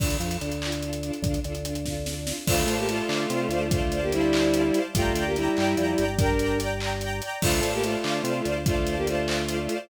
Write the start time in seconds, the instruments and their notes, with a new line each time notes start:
0.00 drawbar organ D2, string ensemble 1 D4 F4, kick, crash
0.04 string ensemble 1 A4
0.10 closed hi-hat
0.20 drawbar organ F2, string ensemble 1 D4 F4, closed hi-hat
0.25 string ensemble 1 A4
0.31 closed hi-hat
0.41 drawbar organ D2, string ensemble 1 D4 F4, closed hi-hat
0.45 string ensemble 1 A4
0.52 closed hi-hat
0.62 string ensemble 1 D4 F4, clap
0.66 string ensemble 1 A4
0.72 closed hi-hat
0.82 string ensemble 1 D4 F4 A4, closed hi-hat
0.93 closed hi-hat
1.03 string ensemble 1 D4 F4, closed hi-hat
1.07 string ensemble 1 A4
1.13 closed hi-hat
1.22 drawbar organ D2, string ensemble 1 D4 F4, kick, closed hi-hat
1.28 string ensemble 1 A4
1.34 closed hi-hat
1.44 drawbar organ D2, string ensemble 1 D4 F4, closed hi-hat
1.49 string ensemble 1 A4
1.55 closed hi-hat
1.65 string ensemble 1 D4 F4, closed hi-hat
1.69 string ensemble 1 A4
1.75 closed hi-hat
1.85 string ensemble 1 D4 F4 A4, kick, snare
2.06 string ensemble 1 D4 F4 A4, snare
2.27 string ensemble 1 D4 F4 A4, snare
2.47 drawbar organ D2, violin A3 F4, string ensemble 1 C5 D5, kick, crash
2.51 string ensemble 1 F5 A5
2.67 drawbar organ A2, string ensemble 1 C5 D5, closed hi-hat
2.72 string ensemble 1 F5 A5
2.78 violin A#3 G4
2.88 violin A3 F4, string ensemble 1 C5 D5 F5, closed hi-hat
2.94 string ensemble 1 A5
3.09 drawbar organ D3, string ensemble 1 C5 D5, clap
3.13 string ensemble 1 F5 A5
3.30 drawbar organ C3, string ensemble 1 C5 D5, closed hi-hat
3.34 string ensemble 1 F5 A5
3.49 drawbar organ D2, string ensemble 1 C5, closed hi-hat
3.53 string ensemble 1 D5 F5 A5
3.71 violin A3 F4, string ensemble 1 C5 D5 F5, kick, closed hi-hat
3.77 string ensemble 1 A5
3.92 string ensemble 1 C5 D5, closed hi-hat
3.96 string ensemble 1 F5 A5
4.02 violin A#3 G4
4.12 violin G3 E4, string ensemble 1 C5 D5, closed hi-hat
4.17 string ensemble 1 F5 A5
4.33 string ensemble 1 C5 D5, clap
4.37 string ensemble 1 F5 A5
4.53 string ensemble 1 C5 D5 F5, closed hi-hat
4.59 string ensemble 1 A5
4.74 string ensemble 1 C5 D5 F5, closed hi-hat
4.80 string ensemble 1 A5
4.95 drawbar organ G1, violin A3 F4, string ensemble 1 D5 G5 A#5, kick, closed hi-hat
5.14 drawbar organ D2, string ensemble 1 D5 G5, closed hi-hat
5.19 string ensemble 1 A#5
5.26 violin A#3 G4
5.36 violin G3 E4, string ensemble 1 D5 G5, closed hi-hat
5.40 string ensemble 1 A#5
5.56 drawbar organ G2, string ensemble 1 D5 G5 A#5, clap
5.77 drawbar organ F2, string ensemble 1 D5 G5 A#5, closed hi-hat
5.97 drawbar organ G1, string ensemble 1 D5 G5 A#5, closed hi-hat
6.18 violin D4 A#4, string ensemble 1 D5 G5 A#5, kick, closed hi-hat
6.39 string ensemble 1 D5 G5, closed hi-hat
6.43 string ensemble 1 A#5
6.60 string ensemble 1 D5 G5 A#5, closed hi-hat
6.80 string ensemble 1 D5 G5 A#5, clap
7.01 string ensemble 1 D5 G5 A#5, closed hi-hat
7.21 string ensemble 1 D5 G5 A#5, closed hi-hat
7.42 drawbar organ D2, violin A3 F4, string ensemble 1 C5 D5 F5, kick, crash
7.48 string ensemble 1 A5
7.61 drawbar organ A2, string ensemble 1 C5 D5, closed hi-hat
7.66 string ensemble 1 F5 A5
7.73 violin A#3 G4
7.83 violin A3 F4, string ensemble 1 C5 D5 F5, closed hi-hat
7.89 string ensemble 1 A5
8.04 drawbar organ D3, string ensemble 1 C5 D5 F5, clap
8.10 string ensemble 1 A5
8.24 drawbar organ C3, string ensemble 1 C5 D5, closed hi-hat
8.29 string ensemble 1 F5 A5
8.45 drawbar organ D2, string ensemble 1 C5 D5 F5, closed hi-hat
8.51 string ensemble 1 A5
8.66 violin A3 F4, string ensemble 1 C5 D5 F5, kick, closed hi-hat
8.72 string ensemble 1 A5
8.87 string ensemble 1 C5 D5 F5, closed hi-hat
8.92 string ensemble 1 A5
8.97 violin A#3 G4
9.07 violin A3 F4, string ensemble 1 C5 D5 F5, closed hi-hat
9.13 string ensemble 1 A5
9.28 string ensemble 1 C5 D5, clap
9.32 string ensemble 1 F5 A5
9.48 string ensemble 1 C5 D5 F5, closed hi-hat
9.54 string ensemble 1 A5
9.69 string ensemble 1 C5 D5, closed hi-hat
9.73 string ensemble 1 F5 A5